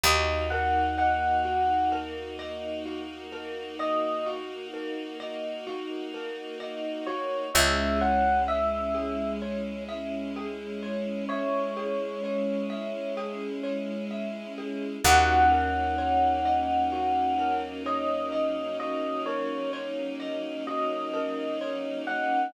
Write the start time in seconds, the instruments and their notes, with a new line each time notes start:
0.04 electric bass (finger) D#2, string ensemble 1 A#3 D#4 F#4, marimba F#4, electric piano 1 D#5
0.50 marimba A#4, electric piano 1 F#5
0.98 marimba D#5, electric piano 1 F#5
1.45 marimba F#4
1.92 marimba A#4
2.39 marimba D#5
2.86 marimba F#4
3.32 marimba A#4
3.79 marimba D#5, electric piano 1 D#5
4.26 marimba F#4
4.74 marimba A#4
5.20 marimba D#5
5.67 marimba F#4
6.14 marimba A#4
6.60 marimba D#5
7.07 marimba F#4, electric piano 1 C#5
7.54 electric bass (finger) C#2, string ensemble 1 G#3 C#4 E4, marimba G#4, electric piano 1 E5
8.01 marimba C#5, electric piano 1 F#5
8.48 marimba E5, electric piano 1 E5
8.95 marimba G#4
9.42 marimba C#5
9.89 marimba E5
10.36 marimba G#4
10.83 marimba C#5
11.29 electric piano 1 C#5, marimba E5
11.77 marimba G#4
12.24 marimba C#5
12.70 marimba E5
13.17 marimba G#4
13.63 marimba C#5
14.11 marimba E5
14.58 marimba G#4
15.04 electric bass (finger) D#2, string ensemble 1 F#3 A#3 C#4 D#4, marimba F#4, electric piano 1 F#5
15.51 marimba A#4
15.98 marimba C#5
16.45 marimba D#5
16.92 marimba F#4
17.39 marimba A#4
17.86 marimba C#5, electric piano 1 D#5
18.32 marimba D#5
18.80 marimba F#4, electric piano 1 D#5
19.26 marimba A#4, electric piano 1 C#5
19.73 marimba C#5
20.20 marimba D#5
20.67 marimba F#4, electric piano 1 D#5
21.14 marimba A#4
21.61 marimba C#5
22.07 marimba D#5, electric piano 1 F#5